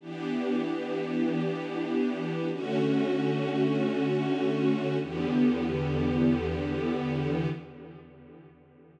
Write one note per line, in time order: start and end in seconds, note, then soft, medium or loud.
0.01 2.49 E3 medium
0.01 2.49 B3 medium
0.01 2.49 D4 medium
0.01 2.49 G4 loud
2.50 4.98 D3 loud
2.50 4.98 A3 medium
2.50 4.98 C#4 loud
2.50 4.98 F#4 loud
4.99 7.47 E2 loud
4.99 7.47 D3 loud
4.99 7.47 B3 loud
4.99 7.47 G4 medium